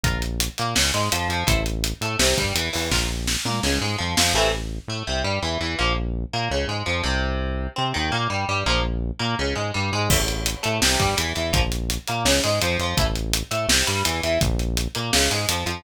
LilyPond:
<<
  \new Staff \with { instrumentName = "Overdriven Guitar" } { \time 4/4 \key a \phrygian \tempo 4 = 167 <f' bes'>8 r4 bes8 des8 gis8 f8 f8 | <e' a' c''>8 r4 a8 c8 g8 e8 e8 | <f' bes'>8 r4 bes8 des8 gis8 f8 f8 | <c e a>8 r4 a8 c8 g8 e8 e8 |
<f bes>8 r4 bes8 des8 gis8 f8 c8~ | c4. c'8 ees8 bes8 g8 g8 | <f bes>8 r4 bes8 des8 gis8 g8 gis8 | <e a>16 r4 r16 a8 c8 g8 e8 e8 |
<f bes>16 r4 r16 bes8 des8 gis8 f8 f8 | <e a>16 r4 r16 a8 c8 g8 e8 e8 | r4. bes8 des8 gis8 f8 f8 | }
  \new Staff \with { instrumentName = "Synth Bass 1" } { \clef bass \time 4/4 \key a \phrygian bes,,4. bes,8 des,8 gis,8 f,8 f,8 | a,,4. a,8 c,8 g,8 e,8 e,8 | bes,,4. bes,8 des,8 gis,8 f,8 f,8 | a,,4. a,8 c,8 g,8 e,8 e,8 |
bes,,4. bes,8 des,8 gis,8 f,8 c,8~ | c,4. c8 ees,8 bes,8 g,8 g,8 | bes,,4. bes,8 des,8 gis,8 g,8 gis,8 | a,,4. a,8 c,8 g,8 e,8 e,8 |
bes,,4. bes,8 des,8 gis,8 f,8 f,8 | a,,4. a,8 c,8 g,8 e,8 e,8 | bes,,4. bes,8 des,8 gis,8 f,8 f,8 | }
  \new DrumStaff \with { instrumentName = "Drums" } \drummode { \time 4/4 <hh bd>8 hh8 hh8 hh8 sn8 hh8 hh8 hh8 | <hh bd>8 hh8 hh8 hh8 sn8 <hh bd>8 hh8 hho8 | <bd sn>4 sn8 toml8 sn4 r8 sn8 | r4 r4 r4 r4 |
r4 r4 r4 r4 | r4 r4 r4 r4 | r4 r4 r4 r4 | <cymc bd>8 hh8 hh8 hh8 sn8 <hh bd>8 hh8 hh8 |
<hh bd>8 hh8 hh8 hh8 sn8 hh8 hh8 hh8 | <hh bd>8 hh8 hh8 hh8 sn8 hh8 hh8 hh8 | <hh bd>8 hh8 hh8 hh8 sn8 hh8 hh8 hh8 | }
>>